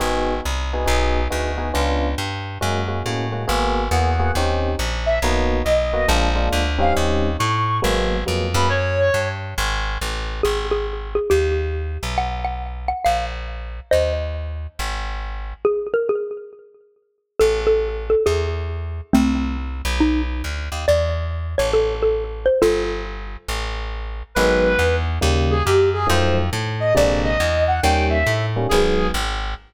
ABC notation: X:1
M:4/4
L:1/8
Q:"Swing" 1/4=138
K:G#m
V:1 name="Clarinet"
z8 | z8 | z2 f2 z3 e | z2 d2 z3 ^e |
z2 c'2 z3 b | c3 z5 | z8 | z8 |
z8 | z8 | [K:Am] z8 | z8 |
z8 | z8 | [K:G#m] B3 z2 G =G ^G | ^B z2 d =d ^d2 f |
=g e2 z ^G2 z2 |]
V:2 name="Xylophone"
z8 | z8 | z8 | z8 |
z8 | z8 | G G2 G =G4 | f f2 f ^e4 |
[^Bd]8 | G A G2 z4 | [K:Am] A A2 A ^G4 | [A,C]4 ^D z3 |
d z2 ^c A A2 =c | [FA]5 z3 | [K:G#m] z8 | z8 |
z8 |]
V:3 name="Electric Piano 1"
[B,DFG]3 [B,DFG] [B,DFG]2 [B,DFG] [B,DFG] | [B,C=D^E]4 [G,A,CF] [G,A,CF] [G,A,CF] [G,A,CF] | [A,B,FG]2 [A,B,FG] [A,B,FG] [^B,CD=G]4 | [A,B,DF]3 [A,B,DF] [G,A,=D^E] [G,A,DE]2 [=G,^B,C^D]- |
[=G,^B,CD]4 [F,^G,A,=B,]2 [F,G,A,B,] [F,G,A,B,] | z8 | z8 | z8 |
z8 | z8 | [K:Am] z8 | z8 |
z8 | z8 | [K:G#m] [D,F,G,B,]4 [C,D,=G,A,]4 | [D,^E,F,=A,]4 [^B,,=D,G,^A,]4 |
[D,=G,A,C]3 [D,G,A,C] [D,F,^G,B,]4 |]
V:4 name="Electric Bass (finger)" clef=bass
G,,,2 =C,,2 B,,,2 =D,,2 | C,,2 =G,,2 F,,2 =A,,2 | G,,,2 E,,2 D,,2 A,,,2 | B,,,2 B,,,2 A,,,2 =D,,2 |
D,,2 =A,,2 G,,,2 ^E,, F,,- | F,,2 =G,,2 ^G,,,2 =A,,,2 | G,,,4 D,,3 B,,,- | B,,,4 A,,,4 |
D,,4 G,,,4 | z8 | [K:Am] A,,,4 E,,4 | C,,3 B,,,3 D,, ^D,, |
E,,3 A,,,5 | G,,,4 A,,,4 | [K:G#m] G,,,2 E,,2 D,,2 F,,2 | ^E,,2 =A,,2 ^A,,,2 =E,,2 |
D,,2 =A,,2 G,,,2 G,,,2 |]